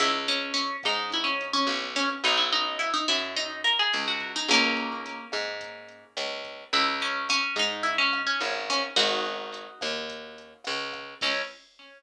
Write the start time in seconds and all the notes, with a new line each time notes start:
0.00 C#2 E4, kick, cross-stick, closed hi-hat
0.28 C#4, closed hi-hat
0.54 C#4, closed hi-hat
0.83 G#2 D#4, kick, cross-stick, closed hi-hat
1.12 E4, kick, closed hi-hat
1.24 C#4
1.41 closed hi-hat
1.53 C#4
1.67 B1, cross-stick, closed hi-hat
1.95 C#4, kick, closed hi-hat
2.24 B1 D#4, kick, closed hi-hat
2.37 E4
2.52 D#4, closed hi-hat
2.79 E4, cross-stick, closed hi-hat
2.94 D#4
3.08 F#2 E4, kick, closed hi-hat
3.36 D#4, kick, closed hi-hat
3.64 A#4, cross-stick, closed hi-hat
3.79 G#4
3.93 C#2, closed hi-hat
4.08 F#4
4.20 kick, closed hi-hat
4.36 D#4
4.48 C#2 A#3 C#4, kick, cross-stick, closed hi-hat
4.77 closed hi-hat
5.06 closed hi-hat
5.32 G#2, kick, cross-stick, closed hi-hat
5.61 kick, closed hi-hat
5.89 closed hi-hat
6.17 C#2, cross-stick, closed hi-hat
6.45 kick, closed hi-hat
6.73 C#2 E4, kick, closed hi-hat
7.00 C#4, closed hi-hat
7.29 C#4, cross-stick, closed hi-hat
7.56 G#2 D#4, kick, closed hi-hat
7.83 E4, kick, closed hi-hat
7.98 C#4
8.13 cross-stick, closed hi-hat
8.27 C#4
8.40 G#1, closed hi-hat
8.69 C#4, kick
8.96 G#1 D#4 F#4, kick, cross-stick, closed hi-hat
9.25 closed hi-hat
9.54 closed hi-hat
9.81 D#2, kick, cross-stick, closed hi-hat
10.09 kick, closed hi-hat
10.38 closed hi-hat
10.64 C#2, cross-stick, closed hi-hat
10.93 kick, cross-stick, closed hi-hat
11.21 C#2 C#4, kick, crash